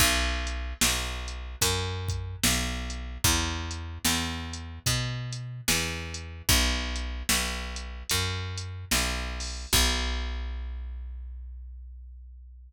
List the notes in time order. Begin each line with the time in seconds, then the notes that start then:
0.00 B1, kick, crash
0.47 closed hi-hat
0.81 B1, snare
1.28 closed hi-hat
1.61 F#2, kick, closed hi-hat
2.08 kick, closed hi-hat
2.43 B1, snare
2.90 closed hi-hat
3.24 E2, kick, closed hi-hat
3.71 closed hi-hat
4.05 E2, snare
4.53 closed hi-hat
4.86 B2, kick, closed hi-hat
5.33 closed hi-hat
5.68 E2, snare
6.14 closed hi-hat
6.49 B1, kick, closed hi-hat
6.96 closed hi-hat
7.29 B1, snare
7.76 closed hi-hat
8.09 F#2, kick, closed hi-hat
8.58 closed hi-hat
8.91 B1, snare
9.40 open hi-hat
9.73 B1, kick, crash